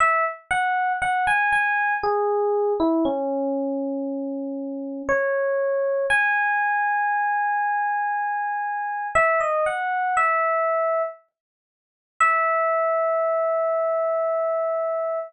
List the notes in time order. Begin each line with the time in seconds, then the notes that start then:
0.00 E5
0.51 F#5
1.02 F#5
1.27 G#5
1.53 G#5
2.03 G#4
2.80 E4
3.05 C#4
5.09 C#5
6.10 G#5
9.15 E5
9.40 D#5
9.66 F#5
10.17 E5
12.20 E5